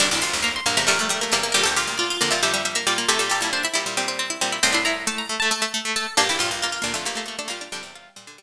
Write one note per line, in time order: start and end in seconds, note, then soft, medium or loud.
0.00 0.10 F1 medium
0.00 0.10 D2 medium
0.00 0.36 G3 medium
0.00 0.10 D4 medium
0.00 0.10 D6 loud
0.11 0.22 F1 medium
0.11 0.22 D2 medium
0.11 0.23 E4 medium
0.11 0.22 D6 medium
0.22 0.32 F1 medium
0.22 0.32 D2 medium
0.22 0.44 F4 medium
0.22 0.41 C6 medium
0.33 0.60 F1 medium
0.33 0.60 D2 medium
0.42 0.60 A#3 medium
0.42 0.54 A#5 medium
0.56 0.66 C6 medium
0.66 0.76 A#1 medium
0.66 0.76 G2 medium
0.66 0.77 A#3 medium
0.66 0.84 A#3 medium
0.77 0.88 E2 medium
0.77 0.88 C3 medium
0.77 0.86 A3 medium
0.77 0.87 A#5 medium
0.87 1.30 A#1 medium
0.87 1.30 G2 medium
0.87 0.99 G3 medium
0.87 0.97 A3 medium
0.87 1.26 A#4 medium
0.99 1.09 G3 medium
0.99 1.09 A3 medium
1.09 1.21 G3 medium
1.09 1.20 A3 medium
1.21 1.34 A3 medium
1.21 1.32 A#3 medium
1.32 1.53 E2 medium
1.32 1.53 C3 medium
1.32 1.43 G3 medium
1.32 1.43 A#3 medium
1.32 1.52 A#4 medium
1.43 1.54 A#3 medium
1.52 1.65 D2 medium
1.52 1.65 A#2 medium
1.52 1.96 G3 medium
1.52 1.65 G4 loud
1.52 1.63 A#4 medium
1.64 1.76 D2 medium
1.64 1.76 A#2 medium
1.64 1.76 G4 medium
1.64 1.74 A4 medium
1.76 1.87 D2 medium
1.76 1.87 A#2 medium
1.76 1.97 F4 medium
1.76 1.96 G4 medium
1.87 2.18 D2 medium
1.87 2.18 A#2 medium
1.98 2.09 F4 medium
1.98 2.17 D5 medium
2.10 2.21 F4 medium
2.21 2.32 F2 medium
2.21 2.32 D3 medium
2.21 2.42 A#3 medium
2.21 2.32 D5 medium
2.31 2.42 A#2 medium
2.31 2.42 G3 medium
2.31 2.42 F4 medium
2.31 2.41 E5 medium
2.43 2.84 F2 medium
2.43 2.84 D3 medium
2.43 2.53 G3 medium
2.43 2.82 G4 medium
2.43 2.53 E5 medium
2.54 2.64 G3 medium
2.54 2.65 E5 medium
2.65 2.75 G3 medium
2.65 2.75 E5 medium
2.75 2.86 A#3 medium
2.75 2.86 E5 medium
2.87 3.06 A#2 medium
2.87 2.97 G3 medium
2.87 3.06 G3 medium
2.87 3.08 F4 medium
2.87 2.97 D5 medium
2.98 3.08 A#3 medium
3.08 3.19 C3 medium
3.08 3.19 A3 medium
3.08 3.45 C4 medium
3.08 3.29 G4 loud
3.08 3.19 A4 medium
3.19 3.30 A#2 medium
3.19 3.30 G3 medium
3.19 3.30 A4 medium
3.30 3.41 A#2 medium
3.30 3.41 G3 medium
3.30 3.40 G4 medium
3.30 3.50 A4 medium
3.41 3.68 A#2 medium
3.41 3.68 G3 medium
3.41 3.51 E4 medium
3.53 3.63 D4 medium
3.53 3.63 C5 medium
3.63 3.73 E4 medium
3.63 4.35 E5 medium
3.74 3.85 A#2 medium
3.74 3.85 G3 medium
3.74 4.14 E4 medium
3.74 3.94 E4 medium
3.86 3.97 A#2 medium
3.86 3.97 G3 medium
3.97 4.37 A#2 medium
3.97 4.37 G3 medium
3.97 4.08 C4 medium
4.08 4.19 C4 medium
4.19 4.30 C4 medium
4.30 4.41 E4 medium
4.41 4.59 A#2 medium
4.41 4.59 G3 medium
4.41 4.52 C4 medium
4.52 4.63 E4 medium
4.63 5.42 C2 medium
4.63 5.42 A2 medium
4.63 4.73 C4 medium
4.63 4.74 C4 medium
4.63 4.73 C6 medium
4.73 4.83 D4 medium
4.73 4.85 E4 medium
4.73 4.85 C6 medium
4.85 5.50 E4 medium
4.85 5.05 E4 medium
4.85 5.03 A#5 medium
5.07 5.27 A3 medium
5.07 5.18 A5 medium
5.18 5.29 A#5 medium
5.29 5.40 A3 medium
5.40 5.50 A3 medium
5.40 5.50 A5 medium
5.51 5.61 A3 medium
5.51 5.88 A4 medium
5.62 5.72 A3 medium
5.74 5.84 A3 medium
5.85 5.95 A3 medium
5.96 6.07 A3 medium
5.96 6.15 A4 loud
6.17 6.28 A#1 medium
6.17 6.28 G2 medium
6.17 6.59 A#3 medium
6.17 6.28 D4 medium
6.17 6.28 G4 medium
6.29 6.39 A#1 medium
6.29 6.39 G2 medium
6.29 6.40 E4 medium
6.29 6.40 G4 medium
6.39 6.50 A#1 medium
6.39 6.50 G2 medium
6.39 6.59 F4 medium
6.39 6.61 F4 medium
6.51 6.79 A#1 medium
6.51 6.79 G2 medium
6.62 6.81 A#3 medium
6.62 6.72 F4 medium
6.72 6.83 F4 medium
6.82 6.94 D2 medium
6.82 6.94 A#2 medium
6.82 6.92 A#3 medium
6.82 7.05 D4 medium
6.94 7.06 F2 medium
6.94 7.06 D3 medium
6.94 7.04 A3 medium
6.94 7.06 F4 medium
7.05 7.45 A#1 medium
7.05 7.45 G2 medium
7.05 7.15 A3 medium
7.05 7.16 A#3 medium
7.05 7.42 G4 medium
7.15 7.25 A3 medium
7.15 7.27 A#3 medium
7.26 7.36 A3 medium
7.26 7.38 A#3 medium
7.39 7.49 A3 medium
7.39 7.49 D4 medium
7.48 7.69 A#2 medium
7.48 7.69 G3 medium
7.48 7.58 A#3 medium
7.48 7.60 A#3 medium
7.48 7.69 F4 medium
7.61 7.72 D4 medium
7.72 7.83 F2 medium
7.72 7.83 D3 medium
7.72 8.15 G3 medium
7.72 7.94 D4 medium
7.72 8.43 G5 medium
7.83 8.10 E2 medium
7.83 8.10 C3 medium
7.95 8.43 F4 medium
8.16 8.43 A#2 medium
8.16 8.27 G3 medium
8.16 8.43 G3 medium
8.27 8.38 D3 medium
8.38 8.43 G3 medium